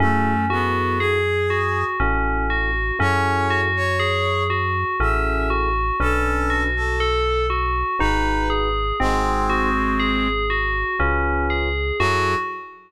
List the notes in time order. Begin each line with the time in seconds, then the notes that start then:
0.00 F#2 A3 C#4 E4 F#4 G#4 A4
0.50 B3 E4 F#4 G#4 A4
0.99 G#4
1.50 F#4
2.00 A1 C#4 E4 F#4 A4
2.50 F#4
2.99 F#2 C#4 E4 F#4 G#4 A4 C#5
3.50 F#4
3.76 C#5
4.00 G#4
4.50 F#4
5.00 A1 C#4 E4 F#4 G#4 A4 E5
5.50 F#4
6.00 B1 C#4 D4 A4 B4
6.50 F#4
6.76 A4
7.00 A4
7.50 F#4
7.99 G#1 D#4 F#4 G#4 B4
8.50 G#4
9.00 G#1 G#3 C4 D#4 F#4 G#4 C5
9.50 F#4
10.00 G#4
10.50 F#4
10.99 C#2 C#4 F4 G#4 B4 C#5
11.50 G#4
12.00 F#2 F#3 E4 F#4 G#4 A4